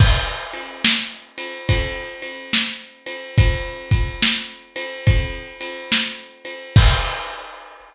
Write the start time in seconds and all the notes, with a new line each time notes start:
0.00 kick, crash
0.53 ride
0.85 snare
1.38 ride
1.69 kick, ride
2.22 ride
2.53 snare
3.06 ride
3.38 kick, ride
3.91 kick, ride
4.22 snare
4.76 ride
5.07 kick, ride
5.61 ride
5.92 snare
6.45 ride
6.76 kick, crash